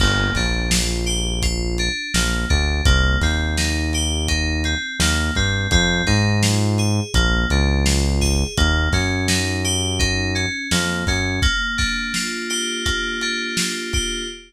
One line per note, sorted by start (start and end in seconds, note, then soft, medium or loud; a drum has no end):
0.00 0.31 G1 loud
0.00 0.33 A#3 medium
0.00 kick loud
0.00 crash loud
0.35 1.89 A#1 medium
0.35 0.69 D4 medium
0.35 kick medium
0.35 snare medium
0.35 closed hi-hat medium
0.71 1.04 F4 medium
0.71 snare loud
1.06 1.39 G4 medium
1.06 closed hi-hat medium
1.42 1.75 F4 medium
1.42 kick medium
1.42 closed hi-hat loud
1.78 2.12 D4 medium
1.78 closed hi-hat medium
2.14 2.45 A#1 medium
2.14 2.47 A#3 medium
2.14 snare loud
2.50 2.82 D2 medium
2.50 2.82 D4 medium
2.50 kick loud
2.50 closed hi-hat medium
2.85 3.17 C2 loud
2.85 3.18 A#3 medium
2.85 kick loud
2.85 closed hi-hat loud
3.21 4.75 D#2 medium
3.21 3.55 C4 medium
3.21 kick medium
3.21 snare medium
3.21 closed hi-hat medium
3.57 3.90 D#4 medium
3.57 snare loud
3.93 4.27 G4 medium
3.93 snare soft
3.93 closed hi-hat medium
4.28 4.61 D#4 medium
4.28 kick medium
4.28 closed hi-hat loud
4.64 4.97 C4 medium
4.64 closed hi-hat medium
5.00 5.31 D#2 medium
5.00 5.33 A#3 medium
5.00 snare loud
5.35 5.67 G2 medium
5.35 5.69 C4 medium
5.35 kick loud
5.35 snare soft
5.35 closed hi-hat medium
5.71 6.03 F2 loud
5.71 6.04 C4 medium
5.71 kick loud
5.71 closed hi-hat loud
6.07 7.00 G#2 medium
6.07 6.39 D#4 medium
6.07 kick medium
6.07 snare medium
6.07 closed hi-hat medium
6.42 6.75 F4 medium
6.42 snare loud
6.78 7.11 G#4 medium
6.78 closed hi-hat medium
7.14 7.45 A#1 medium
7.14 7.47 A#3 medium
7.14 kick loud
7.14 closed hi-hat loud
7.50 8.44 C#2 medium
7.50 7.84 D4 medium
7.50 closed hi-hat medium
7.85 8.18 F4 medium
7.85 snare loud
8.21 8.54 G#4 medium
8.21 kick medium
8.21 snare medium
8.57 8.89 D#2 loud
8.57 8.90 A#3 medium
8.57 kick loud
8.57 closed hi-hat loud
8.93 10.46 F#2 medium
8.93 9.26 C#4 medium
8.93 kick medium
8.93 snare medium
8.93 closed hi-hat medium
9.28 9.61 D#4 medium
9.28 snare loud
9.64 9.97 G4 medium
9.64 closed hi-hat medium
9.99 10.32 D#4 medium
9.99 kick loud
9.99 closed hi-hat loud
10.35 10.68 C#4 medium
10.35 closed hi-hat medium
10.71 11.04 F2 medium
10.71 11.04 A#3 medium
10.71 snare loud
11.07 11.40 F#2 medium
11.07 11.40 C#4 medium
11.07 kick loud
11.07 open hi-hat medium
11.42 12.85 A#3 medium
11.42 kick loud
11.42 closed hi-hat loud
11.78 13.21 D4 medium
11.78 kick loud
11.78 snare medium
11.78 closed hi-hat medium
12.14 13.57 F4 medium
12.14 snare loud
12.50 13.93 G4 medium
12.50 closed hi-hat medium
12.85 14.22 A#3 medium
12.85 kick medium
12.85 closed hi-hat loud
13.21 14.25 D4 medium
13.21 closed hi-hat medium
13.57 14.26 F4 medium
13.57 snare loud
13.93 14.28 G4 medium
13.93 kick loud
13.93 closed hi-hat medium